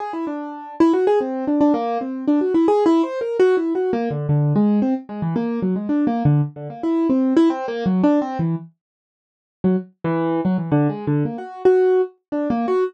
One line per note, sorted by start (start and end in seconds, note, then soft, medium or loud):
0.00 0.12 G#4 medium
0.13 0.25 E4 medium
0.27 0.75 D4 medium
0.80 0.92 E4 loud
0.93 1.05 F#4 medium
1.07 1.19 G#4 loud
1.21 1.45 C4 medium
1.47 1.59 D4 medium
1.61 1.73 D4 medium
1.74 1.98 A#3 loud
2.01 2.25 C4 medium
2.28 2.40 D4 medium
2.41 2.53 F#4 medium
2.54 2.66 E4 medium
2.68 2.84 G#4 loud
2.86 3.02 E4 loud
3.03 3.19 C5 medium
3.21 3.37 A#4 medium
3.40 3.56 F#4 loud
3.57 3.73 E4 medium
3.75 3.91 F#4 medium
3.93 4.09 A#3 loud
4.11 4.27 D3 medium
4.29 4.53 D3 medium
4.56 4.80 G#3 medium
4.82 4.94 C4 medium
5.09 5.21 G#3 medium
5.22 5.34 E3 medium
5.36 5.60 A#3 medium
5.62 5.74 F#3 medium
5.76 5.88 G#3 medium
5.89 6.05 D4 medium
6.07 6.23 A#3 medium
6.25 6.41 D3 medium
6.56 6.68 D3 medium
6.70 6.82 A#3 medium
6.83 7.07 E4 medium
7.09 7.34 C4 medium
7.37 7.49 E4 loud
7.50 7.66 C4 loud
7.68 7.84 A#3 loud
7.86 8.02 F#3 medium
8.03 8.20 D4 loud
8.22 8.38 C4 loud
8.39 8.55 E3 medium
9.64 9.76 F#3 medium
10.04 10.41 E3 loud
10.45 10.57 F#3 medium
10.58 10.70 E3 medium
10.72 10.88 D3 loud
10.89 11.05 G#3 medium
11.07 11.23 D3 medium
11.25 11.37 A#3 soft
11.38 11.62 F#4 medium
11.65 12.01 F#4 medium
12.32 12.48 D4 medium
12.50 12.66 A#3 medium
12.68 12.84 F#4 medium